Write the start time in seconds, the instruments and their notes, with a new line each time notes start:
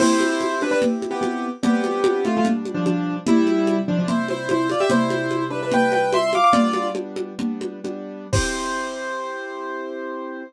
0.00 acoustic grand piano C4 E4 G4 C5, crash, low conga
0.20 high conga
0.41 high conga
0.61 acoustic grand piano D4 B4, high conga
0.71 acoustic grand piano D4 B4
0.82 low conga
1.02 high conga
1.11 acoustic grand piano B3 G4
1.21 acoustic grand piano B3 G4, high conga
1.63 acoustic grand piano G3 B3 C4 D4 G4, low conga
1.84 high conga
2.04 high conga
2.25 acoustic grand piano A3 F4, high conga
2.37 acoustic grand piano A3 F4
2.45 acoustic grand piano B2 G3 D4, low conga
2.65 high conga
2.74 acoustic grand piano F3 D4
2.86 acoustic grand piano F3 D4, high conga
3.26 acoustic grand piano C3 G3 E4, low conga
3.47 high conga
3.67 high conga
3.88 acoustic grand piano F3 D4
3.99 acoustic grand piano F3 D4
4.08 acoustic grand piano E4 C5, low conga
4.28 acoustic grand piano E4 C5, high conga
4.49 acoustic grand piano E4 C5, high conga
4.69 acoustic grand piano F4 D5, high conga
4.80 acoustic grand piano G4 E5
4.90 acoustic grand piano C3 G3 E4 C5, low conga
5.10 high conga
5.31 high conga
5.50 acoustic grand piano D4 B4
5.63 acoustic grand piano D4 B4
5.72 acoustic grand piano B4 G5, low conga
5.92 acoustic grand piano B4 G5, high conga
6.13 acoustic grand piano E5 C6, high conga
6.33 acoustic grand piano F5 D6, high conga
6.44 acoustic grand piano F5 D6
6.53 acoustic grand piano G3 B3 D4 F4 D5, low conga
6.73 high conga
6.95 acoustic grand piano G3 B3 D4, high conga
7.16 high conga
7.39 acoustic grand piano G3 B3 D4, low conga
7.61 high conga
7.84 acoustic grand piano G3 B3 D4, high conga
8.33 acoustic grand piano C4 E4 G4 C5, kick, crash